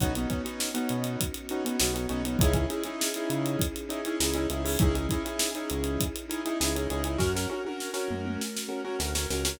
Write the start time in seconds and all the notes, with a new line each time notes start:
0.00 B1 B3 C#4 D#4 F#4, kick, closed hi-hat
0.15 B3 C#4 D#4 F#4, closed hi-hat
0.30 B3 C#4 D#4 F#4, kick, closed hi-hat
0.45 B3 C#4 D#4 F#4, closed hi-hat
0.60 snare
0.74 B3 C#4 D#4 F#4, closed hi-hat
0.89 B2, closed hi-hat
1.04 closed hi-hat
1.21 kick, closed hi-hat
1.34 closed hi-hat
1.49 B3 C#4 D#4 F#4, closed hi-hat
1.65 B3 C#4 D#4 F#4, closed hi-hat
1.79 B1 B3 C#4 D#4 F#4, snare
1.94 B3 C#4 D#4 F#4, closed hi-hat
2.09 B1 B3 C#4 D#4 F#4, closed hi-hat
2.25 B3 C#4 D#4 F#4, closed hi-hat
2.39 C#2 C#4 D#4 E4 G#4, kick, closed hi-hat
2.54 C#4 D#4 E4 G#4, kick, closed hi-hat
2.70 C#4 D#4 E4 G#4, closed hi-hat
2.83 C#4 D#4 E4 G#4, closed hi-hat
3.01 snare
3.14 C#4 D#4 E4 G#4, closed hi-hat
3.30 C#3, closed hi-hat
3.46 closed hi-hat
3.59 kick, closed hi-hat
3.76 closed hi-hat
3.89 C#4 D#4 E4 G#4, closed hi-hat
4.05 C#4 D#4 E4 G#4, closed hi-hat
4.20 C#2 C#4 D#4 E4 G#4, snare
4.34 C#4 D#4 E4 G#4, closed hi-hat
4.50 C#2 C#4 D#4 E4 G#4, closed hi-hat
4.65 C#4 D#4 E4 G#4, open hi-hat
4.79 C#2 C#4 D#4 E4 G#4, kick, closed hi-hat
4.94 C#4 D#4 E4 G#4, closed hi-hat
5.09 C#4 D#4 E4 G#4, kick, closed hi-hat
5.25 C#4 D#4 E4 G#4, closed hi-hat
5.39 snare
5.55 C#4 D#4 E4 G#4, closed hi-hat
5.70 C#2, closed hi-hat
5.84 closed hi-hat
6.00 kick, closed hi-hat
6.16 closed hi-hat
6.29 C#4 D#4 E4 G#4, closed hi-hat
6.45 C#4 D#4 E4 G#4, closed hi-hat
6.60 C#2 C#4 D#4 E4 G#4, snare
6.76 C#4 D#4 E4 G#4, closed hi-hat
6.90 C#2 C#4 D#4 E4 G#4, closed hi-hat
7.04 C#4 D#4 E4 G#4, closed hi-hat
7.18 F#2 C#4 F#4 A#4, kick, snare
7.35 C#4 F#4 A#4, snare
7.50 C#4 F#4 A#4, high tom
7.65 C#4 F#4 A#4, high tom
7.80 snare
7.94 C#4 F#4 A#4, snare
8.09 F#2, mid tom
8.25 mid tom
8.41 snare
8.56 snare
8.69 C#4 F#4 A#4
8.85 C#4 F#4 A#4
8.99 D2 C#4 F#4 A#4, snare
9.15 C#4 F#4 A#4, snare
9.30 C#2 C#4 F#4 A#4, snare
9.45 C#4 F#4 A#4, snare